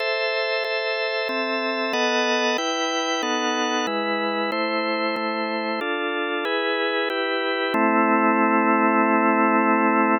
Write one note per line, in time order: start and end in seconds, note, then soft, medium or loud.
0.00 0.64 A4 medium
0.00 0.64 C5 medium
0.00 0.64 E5 medium
0.64 1.28 A4 medium
0.64 1.28 C5 medium
0.64 1.28 E5 medium
1.29 1.93 C4 medium
1.29 1.93 A4 medium
1.29 1.93 E5 medium
1.93 2.57 B3 medium
1.93 2.57 A4 medium
1.93 2.57 D#5 medium
1.93 2.57 F#5 medium
2.58 3.22 E4 medium
2.58 3.22 B4 medium
2.58 3.22 G5 medium
3.23 3.86 B3 medium
3.23 3.86 D#4 medium
3.23 3.86 A4 medium
3.23 3.86 F#5 medium
3.87 4.51 G#3 medium
3.87 4.51 E4 medium
3.87 4.51 B4 medium
4.52 5.16 A3 medium
4.52 5.16 E4 medium
4.52 5.16 C5 medium
5.16 5.80 A3 medium
5.16 5.80 E4 medium
5.16 5.80 C5 medium
5.81 6.45 D4 medium
5.81 6.45 F4 medium
5.81 6.45 A4 medium
6.45 7.09 E4 medium
6.45 7.09 G#4 medium
6.45 7.09 B4 medium
7.10 7.74 E4 medium
7.10 7.74 G4 medium
7.10 7.74 B4 medium
7.74 10.18 A3 loud
7.74 10.18 C4 loud
7.74 10.18 E4 loud